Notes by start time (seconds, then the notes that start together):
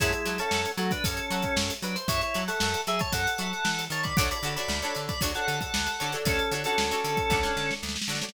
0.00 F#2 G#3 E4 E5 F#5 A5 C#6, kick, closed hi-hat
0.13 G#3 E4, closed hi-hat
0.26 F#3 E5 F#5 A5 C#6, closed hi-hat
0.38 C#4 A4 E5 F#5 A5 C#6, closed hi-hat
0.51 F#2 E5 F#5 A5 C#6, snare
0.65 closed hi-hat
0.77 F#3 A3 F#4, closed hi-hat
0.91 D4 B4, kick, closed hi-hat
1.04 F#2 C#4 A4, kick, closed hi-hat
1.17 closed hi-hat
1.30 F#3 E5 F#5 A5 C#6, closed hi-hat
1.42 kick, closed hi-hat
1.56 F#2, snare
1.70 closed hi-hat
1.82 F#3 D4 B4, closed hi-hat
1.96 C5, closed hi-hat
2.08 F#2 E4 C#5, kick, closed hi-hat
2.21 E4 C#5, snare, closed hi-hat
2.34 F#3 E5 F#5 A5 C#6, closed hi-hat
2.48 A4 E5 F#5 A5 C#6, snare, closed hi-hat
2.60 F#2 E5 F#5 A5 C#6, snare
2.74 snare, closed hi-hat
2.87 F#3 G#4 E5, closed hi-hat
2.99 C#5 A5, kick, closed hi-hat
3.12 F#2 A4 F#5, kick, closed hi-hat
3.27 closed hi-hat
3.38 F#3 E5 F#5 A5 C#6, closed hi-hat
3.53 closed hi-hat
3.65 E3, snare
3.79 snare, closed hi-hat
3.90 D#3 C#5 A5, closed hi-hat
4.03 D5 B5, kick, closed hi-hat
4.17 D2 D4 F#4 A4 C#5 F#5 D6, kick, closed hi-hat
4.31 D5 B5, closed hi-hat
4.43 D3 D4 F#4 A4 C#5, closed hi-hat
4.56 D4 F#4 A4 C#5 D5 B5, closed hi-hat
4.68 D2, snare
4.82 D4 F#4 A4 C#5, closed hi-hat
4.95 D3, closed hi-hat
5.08 D5 B5, kick, snare, closed hi-hat
5.21 D2 D4 F#4 A4 C#5, kick, closed hi-hat
5.35 D4 F#4 A4 C#5 F#5, closed hi-hat
5.47 D3 A4 F#5, closed hi-hat
5.61 A4 F#5, kick, closed hi-hat
5.74 D2, snare
5.87 snare, closed hi-hat
6.00 D3 D4 F#4 A4 C#5, closed hi-hat
6.12 D4 F#4 A4 C#5, closed hi-hat
6.25 D2 C#4 A4, kick, closed hi-hat
6.39 closed hi-hat
6.52 D3 D4 F#4 A4 C#5, closed hi-hat
6.64 C#4 D4 F#4 A4 C#5, closed hi-hat
6.78 D2, snare
6.91 D4 F#4 A4 C#5, closed hi-hat
7.04 D3, closed hi-hat
7.17 kick, closed hi-hat
7.30 D2 D4 F#4 A4 C#5, kick, snare
7.43 D4 F#4 A4 C#5, snare
7.57 D3, snare
7.71 snare
7.83 D2, snare
7.89 snare
7.96 snare
8.02 snare
8.08 D3 D4 F#4 A4 C#5, snare
8.15 snare
8.22 D4 F#4 A4 C#5, snare
8.29 snare